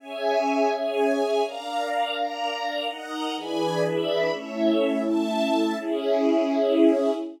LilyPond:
<<
  \new Staff \with { instrumentName = "String Ensemble 1" } { \time 3/4 \key cis \minor \tempo 4 = 125 <cis'' e'' gis''>4. <gis' cis'' gis''>4. | <d'' eis'' ais''>4. <ais' d'' ais''>4. | <dis'' fis'' ais''>4 <e' d'' gis'' b''>4 <e' d'' e'' b''>4 | <a' cis'' e''>4. <a' e'' a''>4. |
<cis' e' gis'>2. | }
  \new Staff \with { instrumentName = "Pad 2 (warm)" } { \time 3/4 \key cis \minor <cis' gis' e''>2. | <d' ais' eis''>2. | <dis' ais' fis''>4 <e d' gis' b'>2 | <a cis' e'>2. |
<cis' gis' e''>2. | }
>>